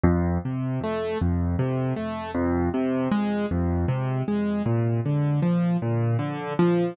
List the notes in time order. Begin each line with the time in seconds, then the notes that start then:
0.04 F2
0.45 C3
0.83 A3
1.21 F2
1.59 C3
1.96 A3
2.34 F2
2.74 C3
3.11 G#3
3.51 F2
3.88 C3
4.28 G#3
4.66 A#2
5.06 D3
5.42 F3
5.82 A#2
6.19 D3
6.59 F3